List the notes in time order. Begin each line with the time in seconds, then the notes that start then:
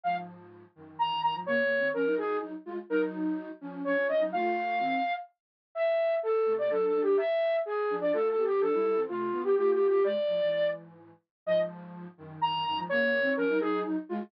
0.04 G#2 F3 F5
0.75 F#2 D#3
0.99 F#2 D#3 A#5
1.10 F#2 D#3
1.23 F#2 D#3 A#5
1.34 G#2 F3
1.46 C#3 A#3 C#5
1.63 C#3 A#3
1.78 D#3 C4
1.94 F3 C#4 A#4
2.06 F#3 D#4
2.18 F#3 D#4 G#4
2.42 F#3 D#4
2.65 G#3 F4
2.89 F#3 D#4 A#4
3.60 F3 C#4
3.84 F3 C#4 C#5
3.97 F3 C#4
4.09 F3 C#4 D#5
4.20 F#3 D#4
4.32 A3 F4 F5
4.79 D#3 C4
5.75 E5
6.23 A4
6.45 C3 A3
6.58 D5
6.70 F#3 D4 A4
6.86 A4
6.94 F#3 D4
7.02 G4
7.17 E5
7.66 G#4
7.90 F3 D4
8.01 D5
8.13 A3 F4 A4
8.29 A4
8.37 B3 G4
8.45 G4
8.61 F3 D4 A4
8.73 G3 E4
8.84 G3 E4
8.96 E3 C4
9.08 C3 A3 F4
9.31 D3 B3
9.44 G4
9.56 A3 F4 G4
9.72 G4
9.88 G4
10.04 B2 G#3 D5
10.27 A2 F3
10.40 G#2 E3
11.46 G#2 F3 D#5
12.17 F#2 D#3
12.41 F#2 D#3 A#5
12.53 F#2 D#3
12.65 F#2 D#3 A#5
12.77 G#2 F3
12.89 C#3 A#3 C#5
13.04 C#3 A#3
13.20 D#3 C4
13.36 F3 C#4 A#4
13.49 F#3 D#4
13.60 F#3 D#4 G#4
13.85 F#3 D#4
14.09 G#3 F4